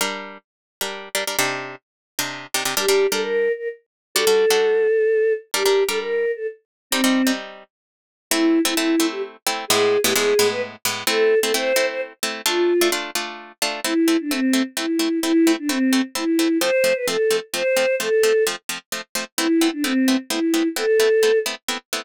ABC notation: X:1
M:3/4
L:1/16
Q:1/4=130
K:Gm
V:1 name="Choir Aahs"
z12 | z12 | G3 A B3 B z4 | A12 |
G3 A B3 A z4 | C4 z8 | [K:Am] E3 E E3 G z4 | ^G3 =G ^G3 B z4 |
A3 A c3 c z4 | F4 z8 | E3 D C3 z E4 | E3 D C3 z E4 |
c3 B A3 z c4 | A4 z8 | E3 D C3 z E4 | A6 z6 |]
V:2 name="Pizzicato Strings"
[G,DB]7 [G,DB]3 [G,DB] [G,DB] | [C,DEG]7 [C,DEG]3 [C,DEG] [C,DEG] | [G,DB] [G,DB]2 [G,DB]9 | [G,D^FA] [G,DFA]2 [G,DFA]9 |
[G,DB] [G,DB]2 [G,DB]9 | [G,CE] [G,CE]2 [G,CE]9 | [K:Am] [A,CE]3 [A,CE] [A,CE]2 [A,CE]4 [A,CE]2 | [A,,^G,B,E]3 [A,,G,B,E] [A,,G,B,E]2 [A,,G,B,E]4 [A,,G,B,E]2 |
[A,CE]3 [A,CE] [A,CE]2 [A,CE]4 [A,CE]2 | [A,DF]3 [A,DF] [A,DF]2 [A,DF]4 [A,DF]2 | [A,CE]2 [A,CE]2 [A,CE]2 [A,CE]2 [A,CE]2 [A,CE]2 | [A,CE]2 [A,CE]2 [A,CE]2 [A,CE]2 [A,CE]2 [A,CE]2 |
[F,A,C]2 [F,A,C]2 [F,A,C]2 [F,A,C]2 [F,A,C]2 [F,A,C]2 | [F,A,C]2 [F,A,C]2 [F,A,C]2 [F,A,C]2 [F,A,C]2 [F,A,C]2 | [A,B,CE]2 [A,B,CE]2 [A,B,CE]2 [A,B,CE]2 [A,B,CE]2 [A,B,CE]2 | [A,B,CE]2 [A,B,CE]2 [A,B,CE]2 [A,B,CE]2 [A,B,CE]2 [A,B,CE]2 |]